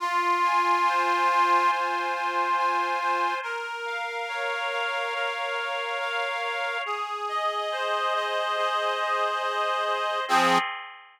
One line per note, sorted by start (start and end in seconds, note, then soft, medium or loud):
0.00 1.71 F4 medium
0.43 1.28 G#5 medium
0.86 2.99 C5 medium
1.29 2.14 G#5 medium
1.71 3.34 F4 medium
2.14 2.57 G#5 medium
2.57 3.39 G#5 medium
3.00 3.41 C5 medium
3.43 5.14 A#4 medium
3.86 4.71 F5 medium
4.29 6.42 C#5 medium
4.72 5.57 F5 medium
5.14 6.77 A#4 medium
5.57 5.99 F5 medium
6.00 6.81 F5 medium
6.43 6.84 C#5 medium
6.86 8.57 G#4 medium
7.29 8.14 D#5 medium
7.71 9.85 C5 medium
8.14 8.99 D#5 medium
8.57 10.20 G#4 medium
9.00 9.42 D#5 medium
9.43 10.24 D#5 medium
9.86 10.26 C5 medium
10.28 10.58 F3 loud
10.28 10.58 C4 loud
10.28 10.58 G#4 loud